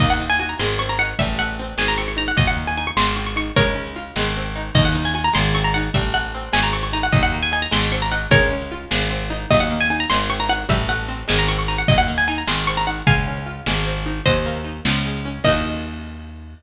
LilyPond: <<
  \new Staff \with { instrumentName = "Pizzicato Strings" } { \time 6/8 \key ees \dorian \tempo 4. = 101 ees''16 ges''16 r16 aes''16 aes''16 bes''16 c'''8 des'''16 bes''16 ges''8 | e''8 ges''8 r8 aes''16 bes''16 des'''16 des'''16 bes''16 ges''16 | ees''16 ges''16 r16 aes''16 aes''16 des'''16 c'''8 des'''16 des'''16 des'''8 | <bes' des''>2~ <bes' des''>8 r8 |
ees''16 ges''16 r16 aes''16 aes''16 bes''16 c'''8 des'''16 bes''16 ges''8 | e''8 ges''8 r8 aes''16 bes''16 des'''16 des'''16 bes''16 ges''16 | ees''16 ges''16 r16 aes''16 aes''16 bes''16 c'''8 des'''16 bes''16 ges''8 | <bes' des''>2~ <bes' des''>8 r8 |
ees''16 ges''16 r16 aes''16 aes''16 bes''16 c'''8 des'''16 bes''16 ges''8 | e''8 ges''8 r8 aes''16 bes''16 des'''16 des'''16 bes''16 ges''16 | ees''16 ges''16 r16 aes''16 aes''16 bes''16 c'''8 des'''16 bes''16 ges''8 | <f'' aes''>2 r4 |
<c'' ees''>2 r4 | ees''2. | }
  \new Staff \with { instrumentName = "Pizzicato Strings" } { \time 6/8 \key ees \dorian bes8 ees'8 ges'8 aes8 c'8 ees'8 | g8 a8 c'8 aes8 c'8 ees'8 | ges8 bes8 ees'8 aes8 c'8 ees'8 | aes8 des'8 f'8 aes8 c'8 ees'8 |
bes8 ees'8 ges'8 aes8 c'8 ees'8 | g8 a8 c'8 aes8 c'8 ees'8 | ges8 bes8 ees'8 aes8 c'8 ees'8 | aes8 des'8 f'8 aes8 c'8 ees'8 |
ges8 bes8 ees'8 aes8 c'8 ees'8 | g8 a8 c'8 aes8 c'8 ees'8 | ges8 bes8 ees'8 aes8 c'8 ees'8 | aes8 des'8 f'8 aes8 c'8 ees'8 |
ges8 bes8 ees'8 f8 aes8 des'8 | <bes ees' ges'>2. | }
  \new Staff \with { instrumentName = "Electric Bass (finger)" } { \clef bass \time 6/8 \key ees \dorian ees,4. aes,,4. | a,,4. aes,,4. | ees,4. aes,,4. | des,4. aes,,4. |
ees,4. aes,,4. | a,,4. aes,,4. | ees,4. aes,,4. | des,4. aes,,4. |
ees,4. aes,,4. | a,,4. aes,,4. | ees,4. aes,,4. | des,4. aes,,4. |
ees,4. des,4. | ees,2. | }
  \new DrumStaff \with { instrumentName = "Drums" } \drummode { \time 6/8 <cymc bd>8. hh8. sn8. hh8. | <hh bd>8. hh8. sn8. hh8. | <hh bd>8. hh8. sn8. hh8. | <hh bd>8. hh8. sn8. hh8. |
<cymc bd>8. hh8. sn8. hh8. | <hh bd>8. hh8. sn8. hh8. | <hh bd>8. hh8. sn8. hh8. | <hh bd>8. hh8. sn8. hh8. |
<hh bd>8. hh8. sn8. hho8. | <hh bd>8. hh8. sn8. hh8. | <hh bd>8. hh8. sn8. hh8. | <hh bd>8. hh8. sn8. hh8. |
<hh bd>8. hh8. sn8. hh8. | <cymc bd>4. r4. | }
>>